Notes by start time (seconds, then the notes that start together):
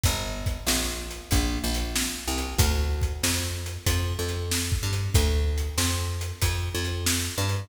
0.04 G1, kick, closed hi-hat
0.46 kick, closed hi-hat
0.67 A#1, snare
1.11 closed hi-hat
1.31 A#1, kick, closed hi-hat
1.64 A#1
1.74 closed hi-hat
1.96 snare
2.28 C2
2.38 closed hi-hat
2.59 D2, kick, closed hi-hat
3.01 kick, closed hi-hat
3.23 F2, snare
3.66 closed hi-hat
3.86 F2, kick, closed hi-hat
4.19 F2
4.28 closed hi-hat
4.51 snare
4.72 kick
4.83 G2
4.93 closed hi-hat
5.14 D2, kick, closed hi-hat
5.58 closed hi-hat
5.78 F2, snare
6.21 closed hi-hat
6.42 F2, kick, closed hi-hat
6.75 F2
6.85 closed hi-hat
7.07 snare
7.38 G2
7.49 closed hi-hat